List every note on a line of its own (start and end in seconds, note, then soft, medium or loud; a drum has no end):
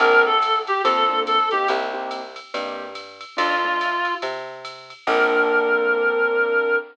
0.00 0.71 A#1 medium
0.00 0.31 A#3 medium
0.00 0.31 C4 medium
0.00 0.31 D4 medium
0.00 0.31 A4 medium
0.00 0.23 A#4 loud
0.00 ride loud
0.26 0.58 A4 loud
0.42 kick medium
0.42 hi-hat pedal medium
0.42 ride loud
0.67 0.82 G4 loud
0.67 ride medium
0.84 1.55 F2 medium
0.84 1.03 A#3 medium
0.84 1.03 C4 medium
0.84 1.03 D4 medium
0.84 1.20 A4 loud
0.84 1.03 A4 medium
0.84 kick medium
0.84 ride loud
1.09 1.37 A#3 medium
1.09 1.37 C4 medium
1.09 1.37 D4 medium
1.09 1.37 A4 medium
1.27 1.49 A4 loud
1.27 hi-hat pedal medium
1.27 ride medium
1.51 1.88 A#3 medium
1.51 1.88 C4 medium
1.51 1.88 D#4 medium
1.51 1.68 G4 loud
1.51 1.88 G4 medium
1.51 ride medium
1.68 2.40 C2 medium
1.68 ride loud
1.94 2.21 A#3 medium
1.94 2.21 C4 medium
1.94 2.21 D#4 medium
1.94 2.21 G4 medium
2.11 hi-hat pedal medium
2.11 ride medium
2.36 ride medium
2.54 3.25 G2 medium
2.54 2.86 A#3 medium
2.54 2.86 C4 medium
2.54 2.86 D#4 medium
2.54 2.86 G4 medium
2.54 ride loud
2.95 hi-hat pedal medium
2.95 ride medium
3.21 ride medium
3.37 4.09 F2 medium
3.37 3.54 A3 medium
3.37 3.54 D4 medium
3.37 3.54 D#4 medium
3.37 3.54 F4 medium
3.37 4.14 F4 loud
3.37 ride loud
3.65 3.92 A3 medium
3.65 3.92 D4 medium
3.65 3.92 D#4 medium
3.65 3.92 F4 medium
3.81 hi-hat pedal medium
3.81 ride medium
4.05 ride medium
4.22 4.93 C3 medium
4.22 ride loud
4.65 hi-hat pedal loud
4.65 ride loud
4.90 ride medium
5.07 6.76 A#1 loud
5.07 6.76 A#3 loud
5.07 6.76 C4 loud
5.07 6.76 D4 loud
5.07 6.76 A4 loud
5.07 6.76 A#4 loud
5.07 kick loud
5.07 crash loud